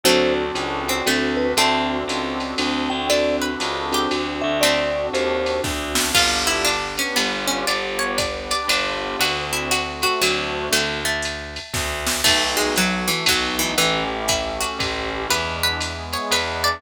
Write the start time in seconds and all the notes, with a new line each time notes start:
0.03 D2 F#3 A3 C4 D4 F#4 A4 C5, ride
0.55 C#2, hi-hat pedal, ride
0.88 C4, ride
1.06 D2 A3 C4 D4 F#4 A4, ride
1.37 B4
1.57 D2 A3 C4 D4 F#4 A4 A5, ride
2.08 C#2, hi-hat pedal, ride
2.40 ride
2.58 D2 C4 D4 F#4 A4, ride
2.90 D2 G5
3.09 C4 D4 F#4 A4 D5, ride
3.42 B4
3.60 C#2, hi-hat pedal, ride
3.92 C4 D4 F#4 G4 A4, ride
4.11 D2 C4 D4 F#4 A4, ride
4.42 D2 E5
4.61 A3 C4 D4 F#4 A4 D5, ride
5.13 D#2 C5, hi-hat pedal, ride
5.46 ride
5.63 D2 C4 D4 F#4 A4, kick, snare
5.95 snare
6.14 G1 B3 D4 F4 G4, kick, crash, ride
6.47 E4
6.65 B3 D4 G4 B4, hi-hat pedal, ride
6.98 C#4, ride
7.16 G1 B3 D4 F4 G4, ride
7.48 C#4
7.67 G1 B3 D4 F4 G4 D5, ride
7.99 C#5
8.18 B3 D4 G4 B4 D5, kick, hi-hat pedal, ride
8.51 D5, ride
8.68 G1 B3 D4 F4 G4, ride
9.19 D2 A3 C4 D4 F#4, ride
9.53 E4
9.71 A3 C4 F#4 A4, hi-hat pedal, ride
10.02 F#4, ride
10.21 D2 F#3 A3 C4 D4 F#4, ride
10.72 D2 A3, ride
11.05 A3
11.22 hi-hat pedal, ride
11.56 ride
11.74 D2, kick, snare
12.07 snare
12.24 B1 A3 B3 D#4 F#4, kick, crash, ride
12.57 G#3
12.76 F#3 A3 B3 F#4 A4, hi-hat pedal, ride
13.08 E3, ride
13.26 B1 F#3 A3 B3 D#4 F#4, kick, ride
13.59 E3
13.77 A1 E3 A3 C#4 E4 G4, ride
14.28 A3 C#4 E4 G4 A4, kick, hi-hat pedal, ride
14.61 F#4, ride
14.79 A1 A3 C#4 E4 G4, kick, ride
15.30 E2 G#3 B3 D4 E4 B4, ride
15.63 B4
15.81 G#3 B3 E4 G#4, hi-hat pedal, ride
16.13 C#5, ride
16.31 E2 G#3 B3 D4 E4 B4, ride
16.64 D5